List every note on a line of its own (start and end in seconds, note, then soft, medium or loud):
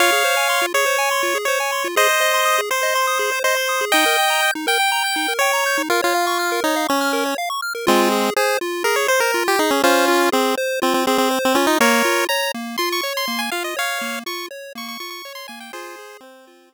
0.00 0.11 F4 medium
0.00 0.66 C#5 medium
0.00 0.66 F5 loud
0.12 0.23 G#4 medium
0.24 0.35 C5 medium
0.37 0.48 G#5 medium
0.49 0.60 C6 medium
0.62 0.73 F4 medium
0.74 0.85 G#4 medium
0.74 1.38 C#5 loud
0.86 0.97 C5 medium
0.98 1.10 G#5 medium
1.11 1.22 C6 medium
1.23 1.34 F4 medium
1.35 1.46 G#4 medium
1.45 1.59 C5 medium
1.45 1.88 C#5 medium
1.60 1.71 G#5 medium
1.72 1.83 C6 medium
1.84 1.95 F4 medium
1.96 2.07 G#4 medium
1.96 2.61 C5 medium
1.96 2.61 D#5 loud
2.09 2.20 C5 medium
2.21 2.32 D#5 medium
2.34 2.45 C6 medium
2.45 2.56 D#6 medium
2.58 2.69 G#4 medium
2.70 2.82 C5 medium
2.70 3.39 C5 loud
2.83 2.94 D#5 medium
2.95 3.06 C6 medium
3.07 3.18 D#6 medium
3.19 3.30 G#4 medium
3.32 3.43 C5 medium
3.44 3.85 C5 loud
3.44 3.55 D#5 medium
3.57 3.68 C6 medium
3.69 3.80 D#6 medium
3.81 3.92 G#4 medium
3.92 4.05 D#4 medium
3.92 4.51 D#5 medium
3.92 4.51 G5 loud
4.06 4.17 A#4 medium
4.18 4.29 G5 medium
4.30 4.41 A#5 medium
4.43 4.54 G6 medium
4.55 4.66 D#4 medium
4.67 4.78 A#4 medium
4.67 5.34 G5 loud
4.80 4.91 G5 medium
4.92 5.03 A#5 medium
5.04 5.15 G6 medium
5.16 5.27 D#4 medium
5.28 5.39 A#4 medium
5.39 5.82 C#5 loud
5.39 5.52 G5 medium
5.53 5.64 A#5 medium
5.66 5.77 G6 medium
5.78 5.89 D#4 medium
5.90 6.01 F4 medium
5.90 6.01 A#4 medium
6.02 6.60 F4 loud
6.02 6.13 C#5 medium
6.15 6.26 F5 medium
6.27 6.38 C#6 medium
6.39 6.50 F6 medium
6.52 6.63 A#4 medium
6.64 6.87 D#4 medium
6.64 6.75 C#5 medium
6.76 6.87 F5 medium
6.89 7.35 C#4 loud
6.89 7.00 C#6 medium
7.01 7.12 F6 medium
7.13 7.24 A#4 medium
7.26 7.37 C#5 medium
7.38 7.49 F5 medium
7.50 7.61 C#6 medium
7.62 7.73 F6 medium
7.75 7.86 A#4 medium
7.87 8.30 G#3 medium
7.87 8.30 C4 loud
7.87 8.09 F4 loud
8.12 8.34 G#4 medium
8.36 8.57 G#4 medium
8.36 8.59 C5 medium
8.61 8.83 F4 medium
8.84 9.07 G#4 medium
8.84 8.96 A#4 medium
8.96 9.08 C#5 medium
9.08 9.20 C5 loud
9.08 9.32 C5 medium
9.20 9.44 A#4 medium
9.34 9.56 F4 medium
9.48 9.59 G4 loud
9.59 9.71 D#4 loud
9.59 9.81 G#4 medium
9.71 9.82 C#4 medium
9.84 10.29 C#4 medium
9.84 10.29 F4 loud
9.84 10.06 C5 medium
10.08 10.30 F4 medium
10.32 10.55 C4 loud
10.32 10.55 G#4 medium
10.57 10.80 C5 medium
10.82 10.94 C4 medium
10.82 11.04 F4 medium
10.94 11.06 C4 medium
11.07 11.18 C4 loud
11.07 11.29 G#4 medium
11.18 11.39 C4 loud
11.31 11.53 C5 medium
11.45 11.57 C4 loud
11.55 11.66 C#4 loud
11.55 11.77 F4 medium
11.67 11.78 D#4 loud
11.80 12.03 A#3 loud
11.80 12.25 A#4 loud
11.80 12.25 C#5 loud
12.05 12.27 F4 medium
12.29 12.52 C#5 medium
12.29 12.52 A#5 medium
12.54 12.77 A#3 medium
12.78 13.01 F4 medium
12.78 12.89 C6 medium
12.92 13.01 C#6 medium
13.01 13.26 C#5 medium
13.01 13.13 C#6 medium
13.17 13.41 C6 loud
13.28 13.50 A#3 medium
13.39 13.50 G#5 medium
13.52 13.74 F4 medium
13.52 13.63 F5 loud
13.64 13.76 D#5 medium
13.77 13.99 C#5 medium
13.77 14.19 C#5 loud
13.77 14.19 F5 loud
14.01 14.24 A#3 medium
14.26 14.48 F4 medium
14.26 14.46 C#6 loud
14.51 14.73 C#5 medium
14.75 14.97 A#3 medium
14.75 14.88 C#6 medium
14.88 14.99 C#6 loud
15.00 15.22 F4 medium
15.00 15.10 C#6 loud
15.10 15.33 C#6 loud
15.25 15.47 C#5 medium
15.35 15.47 C6 loud
15.48 15.71 A#3 medium
15.48 15.59 G#5 medium
15.60 15.72 G5 medium
15.73 15.96 F4 loud
15.73 16.17 G#4 loud
15.73 16.17 C5 loud
15.99 16.21 G#4 medium
16.21 16.74 C4 medium
16.21 16.45 C5 medium
16.47 16.69 F4 medium
16.72 16.74 G#4 medium